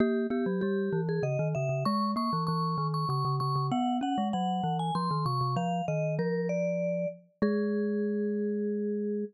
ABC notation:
X:1
M:3/4
L:1/16
Q:1/4=97
K:G#m
V:1 name="Vibraphone"
=G2 G2 G3 ^G d2 e2 | c'2 c'2 c'3 c' c'2 c'2 | f2 f2 f3 g ^b2 c'2 | ^e2 d2 A2 =d4 z2 |
G12 |]
V:2 name="Glockenspiel"
A,2 B, F, =G,2 E,2 C, D, C, C, | G,2 A, E, E,2 D,2 C, C, C, C, | B,2 C G, F,2 E,2 ^E, D, ^B,, B,, | ^E,2 D,2 E,6 z2 |
G,12 |]